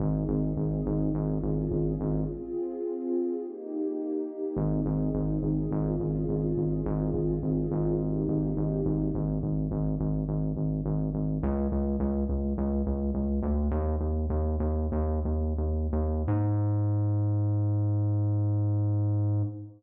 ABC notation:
X:1
M:4/4
L:1/8
Q:1/4=105
K:Ab
V:1 name="Pad 2 (warm)"
[CEA]4 [DFA]4 | [CFA]4 [B,EG]4 | [CEA]4 [DFA]4 | [CFA]4 [B,EG]4 |
z8 | z8 | "^rit." z8 | z8 |]
V:2 name="Synth Bass 1" clef=bass
A,,, A,,, A,,, A,,, A,,, A,,, A,,, A,,, | z8 | A,,, A,,, A,,, A,,, A,,, A,,, A,,, A,,, | A,,, A,,, A,,, A,,,2 A,,, A,,, A,,, |
A,,, A,,, A,,, A,,, A,,, A,,, A,,, A,,, | D,, D,, D,, D,, D,, D,, D,, =D,, | "^rit." E,, E,, E,, E,, E,, E,, E,, E,, | A,,8 |]